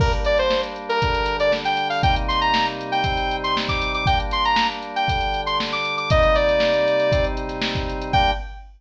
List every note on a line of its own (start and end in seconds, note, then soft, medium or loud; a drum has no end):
0.00 1.00 G3 medium
0.00 1.00 A#3 medium
0.00 1.00 D4 medium
0.00 0.12 A#4 medium
0.00 kick loud
0.00 crash loud
0.12 snare soft
0.12 closed hi-hat medium
0.25 0.38 D5 medium
0.25 closed hi-hat medium
0.38 0.61 C5 medium
0.38 closed hi-hat medium
0.51 snare loud
0.63 snare soft
0.63 closed hi-hat medium
0.76 closed hi-hat medium
0.89 1.37 A#4 medium
0.89 closed hi-hat medium
1.02 2.03 D3 medium
1.02 2.02 G3 medium
1.02 2.03 D4 medium
1.02 kick loud
1.02 closed hi-hat loud
1.15 closed hi-hat medium
1.26 closed hi-hat loud
1.40 1.52 D5 medium
1.40 closed hi-hat medium
1.52 snare loud
1.65 1.88 G5 medium
1.65 snare medium
1.65 closed hi-hat medium
1.77 closed hi-hat medium
1.90 2.02 F5 medium
1.90 open hi-hat medium
2.03 3.03 C3 medium
2.03 3.03 G3 medium
2.03 3.03 A#3 medium
2.03 3.03 D#4 medium
2.03 2.15 G5 medium
2.03 kick loud
2.03 closed hi-hat loud
2.16 closed hi-hat loud
2.28 2.40 C6 medium
2.28 closed hi-hat loud
2.41 2.66 A#5 medium
2.41 closed hi-hat medium
2.54 snare loud
2.66 snare soft
2.66 closed hi-hat medium
2.81 closed hi-hat medium
2.92 3.36 G5 medium
2.92 snare soft
2.92 closed hi-hat medium
3.04 4.05 C3 medium
3.04 4.05 G3 medium
3.04 4.05 C4 medium
3.04 4.05 D#4 medium
3.04 kick loud
3.04 closed hi-hat loud
3.17 closed hi-hat medium
3.31 closed hi-hat medium
3.44 3.56 C6 medium
3.44 closed hi-hat medium
3.57 snare loud
3.69 3.92 D6 medium
3.69 kick loud
3.69 snare medium
3.69 closed hi-hat medium
3.82 closed hi-hat loud
3.94 4.06 D6 medium
3.94 closed hi-hat medium
4.06 5.08 G3 medium
4.06 5.08 A#3 medium
4.06 5.08 D4 medium
4.06 4.19 G5 medium
4.06 kick loud
4.06 closed hi-hat loud
4.20 closed hi-hat medium
4.31 4.44 C6 medium
4.31 closed hi-hat medium
4.45 4.67 A#5 medium
4.45 closed hi-hat medium
4.56 snare loud
4.72 closed hi-hat medium
4.82 closed hi-hat medium
4.96 5.41 G5 medium
4.96 closed hi-hat medium
5.08 6.10 D3 medium
5.08 6.10 G3 medium
5.08 6.10 D4 medium
5.08 kick loud
5.08 closed hi-hat loud
5.21 closed hi-hat medium
5.34 closed hi-hat medium
5.46 5.58 C6 medium
5.46 closed hi-hat medium
5.60 snare loud
5.72 5.96 D6 medium
5.72 snare medium
5.72 closed hi-hat medium
5.85 closed hi-hat medium
5.97 6.09 D6 medium
5.97 closed hi-hat medium
6.10 7.12 C3 medium
6.10 7.12 G3 medium
6.10 7.12 A#3 medium
6.10 7.12 D#4 medium
6.10 6.35 D#5 medium
6.10 kick loud
6.10 closed hi-hat loud
6.23 closed hi-hat medium
6.35 7.25 D5 medium
6.35 snare soft
6.35 closed hi-hat medium
6.49 closed hi-hat medium
6.60 snare loud
6.73 closed hi-hat medium
6.88 closed hi-hat medium
7.00 closed hi-hat medium
7.12 8.13 C3 medium
7.12 8.13 G3 medium
7.12 8.13 C4 medium
7.12 8.13 D#4 medium
7.12 kick loud
7.12 closed hi-hat loud
7.24 closed hi-hat medium
7.37 closed hi-hat medium
7.49 snare soft
7.49 closed hi-hat medium
7.62 snare loud
7.75 kick loud
7.75 snare medium
7.75 closed hi-hat medium
7.90 closed hi-hat medium
8.01 closed hi-hat medium
8.13 8.32 G3 loud
8.13 8.32 A#3 loud
8.13 8.32 D4 loud
8.13 8.31 G5 loud
8.13 kick loud
8.13 crash loud